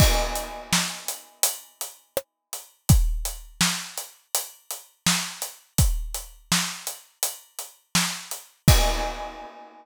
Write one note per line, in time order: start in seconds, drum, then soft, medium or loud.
0.00 kick medium
0.00 crash loud
0.35 closed hi-hat medium
0.73 snare medium
1.08 closed hi-hat medium
1.43 closed hi-hat loud
1.81 closed hi-hat medium
2.17 cross-stick medium
2.53 closed hi-hat medium
2.89 kick loud
2.89 closed hi-hat medium
3.25 closed hi-hat medium
3.61 snare medium
3.98 closed hi-hat medium
4.35 closed hi-hat medium
4.71 closed hi-hat medium
5.06 snare loud
5.42 closed hi-hat medium
5.78 kick medium
5.78 closed hi-hat medium
6.14 closed hi-hat medium
6.52 snare medium
6.87 closed hi-hat medium
7.23 closed hi-hat medium
7.59 closed hi-hat medium
7.95 snare medium
8.31 closed hi-hat medium
8.68 kick loud
8.68 crash loud